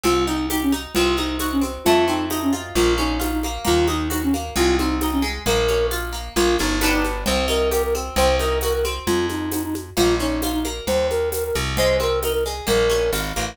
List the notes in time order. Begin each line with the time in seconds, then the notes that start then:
0.03 C2 C4 F4, cowbell, low conga, shaker
0.27 D#4, shaker
0.50 D#4 G4, tambourine, cowbell, high conga, shaker
0.62 C#4
0.72 D#4, high conga, shaker
0.94 C2 C4 F4, cowbell, low conga, shaker
1.17 D#4, high conga, shaker
1.39 D#4 F#4, tambourine, cowbell, high conga, shaker
1.52 C#4
1.61 C4, high conga, shaker
1.85 F2 A3 F4, cowbell, low conga, shaker
2.07 C4 D#4, shaker
2.30 D#4, tambourine, cowbell, high conga, shaker
2.42 C#4
2.53 F4, high conga, shaker
2.75 A#1 A#3 F4, cowbell, low conga, shaker
2.98 C#4 D#4, high conga, shaker
3.20 D#4 F4, tambourine, cowbell, high conga, shaker
3.33 D#4
3.43 A#3, high conga, shaker
3.64 D#2 A#3 F4, cowbell, low conga, shaker
3.88 D#4, high conga, shaker
4.10 D#4 F#4, tambourine, cowbell, high conga, shaker
4.23 C#4
4.34 A#3, high conga, shaker
4.56 C2 G#3 F4, cowbell, low conga, shaker
4.78 C4 D#4, high conga, shaker
5.01 D#4, tambourine, cowbell, high conga, shaker
5.12 C#4
5.22 G#3, shaker
5.46 A#1 A#3 A#4, cowbell, low conga, shaker
5.68 C#4, high conga, shaker
5.91 F4, tambourine, cowbell, high conga, shaker
6.13 A#3, shaker
6.36 A#1 A#3 F4, cowbell, low conga, shaker
6.58 G1 C#4 D#4, high conga, shaker
6.81 B3 D4 D#4 G4, tambourine, cowbell, high conga, shaker
6.93 D#4
7.04 high conga, shaker
7.26 C2 C4 C5, cowbell, low conga, shaker
7.48 D#4 A#4, high conga, shaker
7.71 G4 A#4, tambourine, cowbell, high conga, shaker
7.83 A#4
7.95 C4, high conga, shaker
8.16 C2 C4 C5, cowbell, low conga, shaker
8.39 D#4 A#4, high conga, shaker
8.61 F#4 A#4, tambourine, cowbell, high conga, shaker
8.74 A#4
8.84 C4, high conga, shaker
9.07 F2 F4, cowbell, low conga, shaker
9.29 D#4, high conga, shaker
9.52 D#4, tambourine, cowbell, high conga, shaker
9.63 D#4
9.75 high conga, shaker
9.97 A#1 A#3 F4, cowbell, low conga, shaker
10.19 C#4 D#4, shaker
10.42 D#4 F4, tambourine, cowbell, high conga, shaker
10.53 D#4
10.64 A#3, high conga, shaker
10.87 D#2 C5, cowbell, low conga, shaker
11.10 A#4, high conga, shaker
11.32 A#4, tambourine, cowbell, high conga, shaker
11.44 A#4
11.55 C2, high conga, shaker
11.77 G#3 C5, cowbell, low conga, shaker
12.00 C4 A#4, high conga, shaker
12.22 D#4 A#4, tambourine, cowbell, high conga, shaker
12.33 A#4
12.46 G#3, shaker
12.67 A#1 A#3 A#4, cowbell, low conga, shaker
12.90 C#4, high conga, shaker
13.13 G#1 F4, tambourine, cowbell, high conga, shaker
13.36 A1 A#3, high conga, shaker